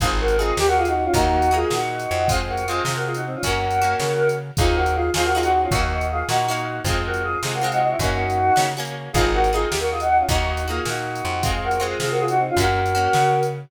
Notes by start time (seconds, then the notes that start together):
0.00 G#1 D#4 F4 G#4, kick, closed hi-hat
0.04 C4
0.20 F#4 A#4
0.28 closed hi-hat
0.38 C4 D#4 F4 G#4
0.57 D#2 G4, snare
0.67 F#4 A#4
0.77 F4 G#4
0.85 D#4 F#4, closed hi-hat
0.95 D#4 F#4
1.04 C#4 F4
1.14 D#2 A#3 D#4 F#4, kick, closed hi-hat
1.42 closed hi-hat
1.51 A#3 D#4 F4 F#4 G#4
1.70 A#2 D#4 F#4, snare
2.00 closed hi-hat
2.11 F2
2.28 G#3 C4 F4 G#4, kick, closed hi-hat
2.48 F#4 A#4
2.57 closed hi-hat
2.67 G#3 C4 F4 G#4
2.83 C3 F4 G#4, snare
2.96 F#4 A#4
3.06 F4 G#4
3.14 D#4 F#4, closed hi-hat
3.26 C4 D#4
3.35 C#4 F4
3.43 F#2 C#4 F#4 A#4, kick, closed hi-hat
3.47 A#3
3.71 closed hi-hat
3.82 A#3 C#4 F#4
4.00 C#3, snare
4.29 closed hi-hat
4.57 D#2 D#4 F4 G#4, kick, closed hi-hat
4.61 C4
4.75 F#4 A#4
4.86 closed hi-hat
4.94 F4 G#4
5.14 D#2 C4 D#4 F4 G#4, snare
5.24 F#4 A#4
5.33 D#4 F4 G#4
5.38 C4
5.42 D#4 F#4, closed hi-hat
5.52 D#4 F#4
5.62 C#4 F4
5.71 D#2 A#3 D#4 F#4, kick, closed hi-hat
6.01 closed hi-hat
6.12 F4 G#4
6.29 A#2 A#3 D#4 F#4, snare
6.48 A#3 D#4 F#4
6.56 closed hi-hat
6.84 F2 G#3 C4 F4 G#4, kick, closed hi-hat
7.05 F#4 A#4
7.14 closed hi-hat
7.23 F4 G#4
7.43 C3 G#3 C4 F4 G#4, snare
7.53 F#4 A#4
7.61 G#3 C4 F4 G#4
7.72 D#4 F#4, closed hi-hat
7.81 D#4 F#4
7.91 E4
7.99 F#2 C#4 D#4 F#4, kick, closed hi-hat
8.04 A#3
8.30 closed hi-hat
8.56 C#3 A#3 C#4 F#4, snare
8.77 A#3 C#4 F#4
8.85 closed hi-hat
9.13 G#1 D#4 F4 G#4, kick, closed hi-hat
9.18 C4
9.34 F#4 A#4
9.44 closed hi-hat
9.53 C4 D#4 F4 G#4
9.69 D#2 G4, snare
9.80 F#4 A#4
9.90 F4 G#4
10.00 D#4 F#4, closed hi-hat
10.09 D#4 F#4
10.20 C#4 F4
10.29 D#2 A#3 D#4 F#4, kick, closed hi-hat
10.57 closed hi-hat
10.68 A#3 D#4 F4 F#4 G#4
10.85 A#2 D#4 F#4, snare
11.15 closed hi-hat
11.25 F2
11.43 G#3 C4 F4 G#4, kick, closed hi-hat
11.64 F#4 A#4
11.71 closed hi-hat
11.80 G#3 C4 F4 G#4
12.00 C3 F4 G#4, snare
12.10 F#4 A#4
12.19 F4 G#4
12.28 D#4 F#4, closed hi-hat
12.38 C4 D#4
12.49 C#4 F4
12.57 F#2 A#3 C#4 F#4 A#4, kick, closed hi-hat
12.86 closed hi-hat
12.95 A#3 C#4 F#4
13.13 C#3, snare
13.43 closed hi-hat